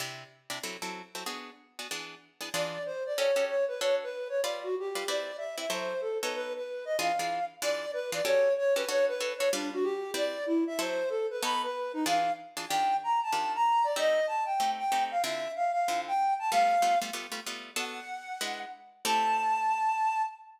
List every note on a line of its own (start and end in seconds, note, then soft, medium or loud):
0.00 0.24 C3 medium
0.00 0.24 D4 medium
0.00 0.24 E4 medium
0.00 0.24 G4 medium
0.50 0.59 C3 medium
0.50 0.59 D4 medium
0.50 0.59 E4 medium
0.50 0.59 G4 medium
0.63 0.77 F#3 medium
0.63 0.77 C4 medium
0.63 0.77 E4 medium
0.63 0.77 A4 medium
0.82 1.02 F#3 medium
0.82 1.02 C4 medium
0.82 1.02 E4 medium
0.82 1.02 A4 medium
1.15 1.24 F#3 medium
1.15 1.24 C4 medium
1.15 1.24 E4 medium
1.15 1.24 A4 medium
1.26 1.50 B3 medium
1.26 1.50 D4 medium
1.26 1.50 F#4 medium
1.26 1.50 G#4 medium
1.79 1.88 B3 medium
1.79 1.88 D4 medium
1.79 1.88 F#4 medium
1.79 1.88 G#4 medium
1.91 2.15 E3 medium
1.91 2.15 B3 medium
1.91 2.15 D4 medium
1.91 2.15 G#4 medium
2.41 2.49 E3 medium
2.41 2.49 B3 medium
2.41 2.49 D4 medium
2.41 2.49 G#4 medium
2.54 2.78 E3 medium
2.54 2.78 D4 medium
2.54 2.78 F4 medium
2.54 2.78 G#4 medium
2.54 2.83 D5 medium
2.86 3.03 C5 medium
3.06 3.18 D5 medium
3.16 3.31 C#4 medium
3.16 3.31 F#4 medium
3.16 3.31 G4 medium
3.16 3.31 A4 medium
3.16 3.45 C#5 medium
3.36 3.56 C#4 medium
3.36 3.56 F#4 medium
3.36 3.56 G4 medium
3.36 3.56 A4 medium
3.48 3.65 C#5 medium
3.68 3.80 B4 medium
3.80 4.05 D4 medium
3.80 4.05 F#4 medium
3.80 4.05 A4 medium
3.80 3.95 C#5 medium
3.80 4.05 C#5 medium
4.03 4.28 B4 medium
4.29 4.40 C#5 medium
4.43 4.68 G3 medium
4.43 4.68 F4 medium
4.43 4.68 B4 medium
4.43 4.60 D5 medium
4.43 4.68 D5 medium
4.63 4.75 F#4 medium
4.79 5.07 G4 medium
4.95 5.04 G3 medium
4.95 5.04 F4 medium
4.95 5.04 B4 medium
4.95 5.04 D5 medium
5.08 5.32 C4 medium
5.08 5.32 E4 medium
5.08 5.32 B4 medium
5.08 5.32 D5 medium
5.08 5.37 D5 medium
5.38 5.56 E5 medium
5.58 5.66 C4 medium
5.58 5.66 E4 medium
5.58 5.66 B4 medium
5.58 5.66 D5 medium
5.58 5.70 E5 medium
5.70 5.94 F#3 medium
5.70 5.94 E4 medium
5.70 5.94 A4 medium
5.70 5.94 C5 loud
5.70 6.01 C5 medium
6.01 6.18 A4 medium
6.22 6.60 B3 medium
6.22 6.60 D#4 medium
6.22 6.60 A4 medium
6.22 6.34 B4 medium
6.22 6.60 C#5 medium
6.35 6.53 B4 medium
6.56 6.85 B4 medium
6.85 6.97 D#5 medium
6.99 7.12 E3 medium
6.99 7.12 D4 medium
6.99 7.12 F4 medium
6.99 7.12 G#4 medium
6.99 7.45 F5 medium
7.19 7.40 E3 medium
7.19 7.40 D4 medium
7.19 7.40 F4 medium
7.19 7.40 G#4 medium
7.62 7.86 E3 loud
7.62 7.86 D4 medium
7.62 7.86 F4 medium
7.62 7.86 G#4 medium
7.62 7.91 D5 loud
7.93 8.11 B4 medium
8.12 8.21 E3 medium
8.12 8.21 D4 medium
8.12 8.21 F4 medium
8.12 8.21 G#4 medium
8.12 8.26 D5 medium
8.25 8.49 C#4 medium
8.25 8.49 F#4 medium
8.25 8.49 G4 loud
8.25 8.49 A4 medium
8.25 8.54 C#5 medium
8.58 8.74 C#5 medium
8.76 8.85 C#4 medium
8.76 8.85 F#4 medium
8.76 8.85 G4 medium
8.76 8.85 A4 medium
8.76 8.88 B4 medium
8.88 9.13 D4 medium
8.88 9.13 F#4 medium
8.88 9.13 A4 medium
8.88 9.13 C#5 loud
8.88 9.05 C#5 loud
9.08 9.33 B4 medium
9.20 9.34 D4 medium
9.20 9.34 F#4 medium
9.20 9.34 A4 medium
9.20 9.34 C#5 medium
9.38 9.49 D4 medium
9.38 9.49 F#4 medium
9.38 9.49 A4 medium
9.38 9.49 C#5 medium
9.53 9.77 G3 loud
9.53 9.71 D4 medium
9.53 9.77 F4 medium
9.53 9.77 B4 medium
9.53 9.77 D5 medium
9.73 9.85 F#4 medium
9.83 10.11 G4 medium
10.14 10.38 C4 medium
10.14 10.38 E4 medium
10.14 10.38 B4 medium
10.14 10.38 D5 medium
10.14 10.44 D5 loud
10.46 10.64 E4 medium
10.67 10.79 E5 medium
10.79 11.03 F#3 medium
10.79 11.03 E4 medium
10.79 11.03 A4 medium
10.79 11.03 C5 medium
10.79 11.09 C5 loud
11.09 11.27 A4 medium
11.30 11.43 B4 medium
11.43 11.67 B3 loud
11.43 11.67 D#4 medium
11.43 11.67 A4 medium
11.43 11.67 C#5 medium
11.43 11.62 B5 loud
11.63 11.92 B4 medium
11.93 12.05 D#4 medium
12.06 12.30 E3 medium
12.06 12.30 D4 loud
12.06 12.30 F4 medium
12.06 12.30 G#4 loud
12.06 12.32 F5 medium
12.57 12.66 E3 medium
12.57 12.66 D4 medium
12.57 12.66 F4 medium
12.57 12.66 G#4 medium
12.69 12.95 D#3 medium
12.69 12.95 D4 medium
12.69 12.95 F4 medium
12.69 12.95 G4 medium
12.69 12.96 G5 medium
13.03 13.20 A#5 medium
13.23 13.52 A5 medium
13.32 13.57 D#3 medium
13.32 13.57 D4 medium
13.32 13.57 F4 medium
13.32 13.57 G4 medium
13.55 13.85 A#5 medium
13.84 13.96 D5 medium
13.96 14.20 A3 medium
13.96 14.20 C4 medium
13.96 14.20 D#4 medium
13.96 14.20 G4 medium
13.96 14.26 D#5 loud
14.27 14.44 A5 medium
14.45 14.71 G5 medium
14.60 14.84 A3 medium
14.60 14.84 C4 medium
14.60 14.84 D#4 medium
14.60 14.84 G4 medium
14.78 15.04 G5 medium
14.92 15.16 A3 medium
14.92 15.16 C4 medium
14.92 15.16 D#4 medium
14.92 15.16 G4 medium
15.11 15.22 F5 medium
15.23 15.48 D3 medium
15.23 15.48 C4 medium
15.23 15.48 E4 medium
15.23 15.48 F4 medium
15.23 15.52 E5 medium
15.56 15.71 F5 medium
15.72 16.00 F5 medium
15.88 16.12 D3 medium
15.88 16.12 C4 medium
15.88 16.12 E4 medium
15.88 16.12 F4 medium
16.07 16.34 G5 medium
16.39 16.50 A5 medium
16.52 16.76 G3 medium
16.52 16.76 A3 medium
16.52 16.76 B3 medium
16.52 16.76 F4 medium
16.52 16.98 F5 loud
16.82 16.96 G3 medium
16.82 16.96 A3 medium
16.82 16.96 B3 medium
16.82 16.96 F4 medium
17.02 17.10 G3 medium
17.02 17.10 A3 medium
17.02 17.10 B3 medium
17.02 17.10 F4 medium
17.13 17.27 G3 medium
17.13 17.27 A3 medium
17.13 17.27 B3 medium
17.13 17.27 F4 medium
17.32 17.40 G3 medium
17.32 17.40 A3 medium
17.32 17.40 B3 medium
17.32 17.40 F4 medium
17.46 17.71 G3 medium
17.46 17.71 A3 medium
17.46 17.71 B3 medium
17.46 17.71 F4 medium
17.76 18.00 B3 medium
17.76 18.00 D4 medium
17.76 18.00 F#4 medium
17.76 18.00 A4 loud
17.76 18.59 F#5 medium
18.41 18.65 G#3 medium
18.41 18.65 D4 medium
18.41 18.65 E4 medium
18.41 18.65 B4 medium
19.05 20.23 A3 loud
19.05 20.23 C4 medium
19.05 20.23 E4 loud
19.05 20.23 G4 medium
19.05 20.22 A5 loud